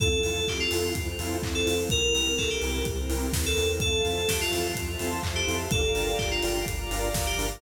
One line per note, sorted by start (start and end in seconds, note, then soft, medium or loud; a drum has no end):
0.00 0.20 F2 medium
0.00 0.08 C4 loud
0.00 0.94 C4 medium
0.00 0.08 E4 loud
0.00 0.94 E4 loud
0.00 0.08 F4 loud
0.00 0.95 F4 medium
0.00 0.08 A4 loud
0.00 0.21 A4 medium
0.00 0.94 A4 loud
0.00 kick loud
0.00 closed hi-hat medium
0.23 0.44 F2 medium
0.23 0.40 C4 medium
0.23 0.40 E4 medium
0.23 0.40 F4 medium
0.23 0.40 A4 medium
0.23 0.44 A4 medium
0.23 open hi-hat medium
0.47 0.68 F2 medium
0.47 0.60 G4 medium
0.47 kick medium
0.47 clap loud
0.60 0.93 F4 medium
0.71 0.92 F2 medium
0.71 0.89 C4 medium
0.71 0.89 E4 loud
0.71 0.89 F4 medium
0.71 0.89 A4 loud
0.71 open hi-hat medium
0.95 1.15 F2 medium
0.95 1.89 C4 loud
0.95 1.89 E4 medium
0.95 1.89 A4 medium
0.95 1.89 C5 loud
0.95 kick medium
0.95 closed hi-hat loud
1.19 1.39 F2 medium
1.19 1.37 C4 medium
1.19 1.37 E4 medium
1.19 1.37 F4 medium
1.19 1.37 A4 medium
1.19 open hi-hat medium
1.43 1.63 F2 medium
1.43 kick medium
1.43 clap loud
1.55 1.75 A4 medium
1.66 1.87 F2 medium
1.66 1.74 C4 medium
1.66 1.74 E4 medium
1.66 1.74 F4 medium
1.66 1.74 A4 medium
1.66 open hi-hat medium
1.89 2.11 C2 medium
1.89 2.84 C4 loud
1.89 2.00 C4 loud
1.89 2.84 E4 loud
1.89 2.00 E4 medium
1.89 2.84 G4 loud
1.89 2.00 G4 loud
1.89 2.84 A#4 medium
1.89 2.13 A#4 medium
1.89 2.00 A#4 loud
1.89 kick loud
1.89 closed hi-hat medium
2.14 2.34 C2 medium
2.14 2.31 C4 medium
2.14 2.31 E4 medium
2.14 2.31 G4 medium
2.14 2.34 A#4 medium
2.14 2.31 A#4 medium
2.14 open hi-hat medium
2.38 2.58 C2 medium
2.38 2.49 A4 medium
2.38 kick medium
2.38 clap loud
2.50 2.85 G4 medium
2.62 2.82 C2 medium
2.62 2.80 C4 medium
2.62 2.80 E4 medium
2.62 2.80 G4 medium
2.62 2.80 A#4 medium
2.62 open hi-hat medium
2.85 3.06 C2 medium
2.85 3.80 C4 loud
2.85 3.80 E4 medium
2.85 3.80 A#4 medium
2.85 3.80 C5 medium
2.85 kick medium
2.85 closed hi-hat medium
3.09 3.29 C2 medium
3.09 3.26 C4 medium
3.09 3.26 E4 medium
3.09 3.26 G4 medium
3.09 3.26 A#4 medium
3.09 open hi-hat medium
3.33 3.55 D#2 medium
3.33 kick medium
3.33 snare loud
3.46 3.69 A4 medium
3.57 3.78 E2 medium
3.57 3.66 C4 medium
3.57 3.66 E4 loud
3.57 3.66 G4 loud
3.57 3.66 A#4 medium
3.57 open hi-hat medium
3.80 4.01 F2 medium
3.80 3.89 C4 medium
3.80 3.89 E4 loud
3.80 3.89 F4 loud
3.80 3.89 A4 loud
3.80 4.02 A4 medium
3.80 4.75 C5 medium
3.80 4.75 E5 medium
3.80 4.75 F5 medium
3.80 4.75 A5 loud
3.80 kick loud
3.80 closed hi-hat medium
4.05 4.25 F2 medium
4.05 4.22 C4 medium
4.05 4.22 E4 medium
4.05 4.22 F4 medium
4.05 4.22 A4 medium
4.05 4.28 A4 medium
4.05 open hi-hat medium
4.28 4.49 F2 medium
4.28 4.40 G4 medium
4.28 kick medium
4.28 snare loud
4.41 4.72 F4 medium
4.51 4.73 F2 medium
4.51 4.68 C4 medium
4.51 4.68 E4 loud
4.51 4.68 F4 medium
4.51 4.68 A4 medium
4.51 open hi-hat medium
4.75 4.96 F2 medium
4.75 5.71 C5 loud
4.75 5.71 E5 loud
4.75 5.71 A5 loud
4.75 5.71 C6 medium
4.75 kick medium
4.75 closed hi-hat loud
4.99 5.20 F2 medium
4.99 5.17 C4 medium
4.99 5.17 E4 medium
4.99 5.17 F4 medium
4.99 5.17 A4 medium
4.99 open hi-hat medium
5.23 5.44 F2 medium
5.23 kick medium
5.23 clap loud
5.36 5.57 G4 medium
5.48 5.68 F2 medium
5.48 5.56 C4 medium
5.48 5.56 E4 medium
5.48 5.56 F4 medium
5.48 5.56 A4 medium
5.48 open hi-hat medium
5.71 5.92 G1 medium
5.71 5.81 D4 loud
5.71 5.81 F4 loud
5.71 5.81 G4 loud
5.71 5.91 A4 medium
5.71 5.81 A#4 loud
5.71 6.66 D5 medium
5.71 6.66 F5 medium
5.71 6.66 G5 loud
5.71 6.66 A#5 medium
5.71 kick loud
5.71 closed hi-hat medium
5.95 6.15 G1 medium
5.95 6.12 D4 medium
5.95 6.12 F4 loud
5.95 6.12 G4 medium
5.95 6.15 A4 medium
5.95 6.12 A#4 medium
5.95 open hi-hat medium
6.18 6.39 G1 medium
6.18 6.30 G4 medium
6.18 kick medium
6.18 clap loud
6.31 6.64 F4 medium
6.43 6.64 G1 medium
6.43 6.59 D4 medium
6.43 6.59 F4 loud
6.43 6.59 G4 medium
6.43 6.59 A#4 medium
6.43 open hi-hat medium
6.66 6.87 G1 medium
6.66 7.61 D5 medium
6.66 7.61 F5 loud
6.66 7.61 A#5 medium
6.66 7.61 D6 medium
6.66 kick medium
6.66 closed hi-hat loud
6.91 7.11 G1 medium
6.91 7.08 D4 medium
6.91 7.08 F4 medium
6.91 7.08 G4 medium
6.91 7.08 A#4 medium
6.91 open hi-hat medium
7.14 7.35 G1 medium
7.14 kick medium
7.14 snare loud
7.27 7.47 G4 medium
7.38 7.58 G1 medium
7.38 7.46 D4 loud
7.38 7.46 F4 medium
7.38 7.46 G4 medium
7.38 7.46 A#4 loud
7.38 open hi-hat medium